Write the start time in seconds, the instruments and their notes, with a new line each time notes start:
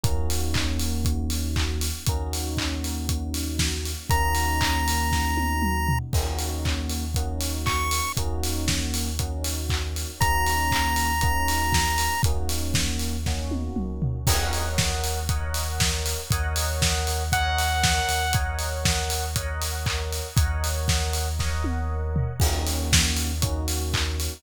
0.03 synth bass 2 D#2, electric piano 1 A#3 C#4 D#4 F#4, kick, closed hi-hat
0.30 open hi-hat
0.54 kick, clap
0.79 open hi-hat
1.05 kick, closed hi-hat
1.30 open hi-hat
1.56 kick, clap
1.81 open hi-hat
2.06 synth bass 2 D#2, electric piano 1 A#3 C#4 D#4 F#4, kick, closed hi-hat
2.33 open hi-hat
2.57 kick, clap
2.84 open hi-hat
3.09 kick, closed hi-hat
3.34 open hi-hat
3.59 kick, snare
3.85 open hi-hat
4.10 synth bass 2 D#2, electric piano 1 A#3 C#4 D#4 F#4, lead 1 (square) A#5, kick, closed hi-hat
4.35 open hi-hat
4.61 kick, clap
4.88 open hi-hat
5.12 kick, snare
5.37 high tom
5.62 mid tom
5.88 floor tom
6.13 synth bass 2 D#2, electric piano 1 A#3 C#4 D#4 F#4, kick, crash
6.39 open hi-hat
6.65 kick, clap
6.90 open hi-hat
7.14 electric piano 1 A#3 C#4 D#4 F#4, kick, closed hi-hat
7.41 open hi-hat
7.66 lead 1 (square) C#6, kick, clap
7.91 open hi-hat
8.17 synth bass 2 D#2, electric piano 1 A#3 C#4 D#4 F#4, kick, closed hi-hat
8.43 open hi-hat
8.68 kick, snare
8.94 open hi-hat
9.19 electric piano 1 A#3 C#4 D#4 F#4, kick, closed hi-hat
9.44 open hi-hat
9.69 kick, clap
9.96 open hi-hat
10.20 synth bass 2 D#2, electric piano 1 A#3 C#4 D#4 F#4, lead 1 (square) A#5, kick, closed hi-hat
10.47 open hi-hat
10.71 kick, clap
10.96 open hi-hat
11.21 electric piano 1 A#3 C#4 D#4 F#4, kick, closed hi-hat
11.48 open hi-hat
11.72 kick, snare
11.98 open hi-hat
12.23 synth bass 2 D#2, electric piano 1 A#3 C#4 D#4 F#4, kick, closed hi-hat
12.49 open hi-hat
12.74 kick, snare
12.99 open hi-hat
13.26 electric piano 1 A#3 C#4 D#4 F#4, kick, snare
13.51 high tom
13.76 synth bass 2 C#2, mid tom
14.02 synth bass 2 D2, floor tom
14.27 synth bass 2 D#2, electric piano 1 A#4 C#5 D#5 F#5, kick, crash
14.53 open hi-hat
14.78 kick, snare
15.04 open hi-hat
15.29 electric piano 1 A#4 C#5 D#5 F#5, kick, closed hi-hat
15.54 open hi-hat
15.80 kick, snare
16.06 open hi-hat
16.31 synth bass 2 D#2, electric piano 1 A#4 C#5 D#5 F#5, kick, closed hi-hat
16.56 open hi-hat
16.82 kick, snare
17.07 open hi-hat
17.32 electric piano 1 A#4 C#5 D#5 F#5, lead 2 (sawtooth) F#5, kick, closed hi-hat
17.58 open hi-hat
17.83 kick, snare
18.09 synth bass 2 D#2, open hi-hat
18.33 electric piano 1 A#4 C#5 D#5 F#5, kick, closed hi-hat
18.59 open hi-hat
18.85 kick, snare
19.10 open hi-hat
19.36 electric piano 1 A#4 C#5 D#5 F#5, kick, closed hi-hat
19.62 open hi-hat
19.86 kick, clap
20.13 open hi-hat
20.36 synth bass 2 D#2, electric piano 1 A#4 C#5 D#5 F#5, kick, closed hi-hat
20.64 open hi-hat
20.88 kick, snare
21.13 open hi-hat
21.39 electric piano 1 A#4 C#5 D#5 F#5, kick, snare
21.64 high tom
22.16 floor tom
22.40 synth bass 2 D#2, electric piano 1 A#3 C#4 D#4 F#4, kick, crash
22.67 open hi-hat
22.93 kick, snare
23.17 open hi-hat
23.42 electric piano 1 A#3 C#4 D#4 F#4, kick, closed hi-hat
23.68 open hi-hat
23.93 kick, clap
24.20 open hi-hat